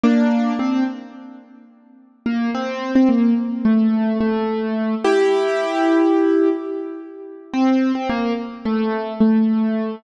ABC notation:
X:1
M:9/8
L:1/16
Q:3/8=72
K:F
V:1 name="Acoustic Grand Piano"
[B,D]4 C2 z10 B,2 | C3 C B,2 z2 A,4 A,6 | [EG]12 z6 | C3 C B,2 z2 A,4 A,6 |]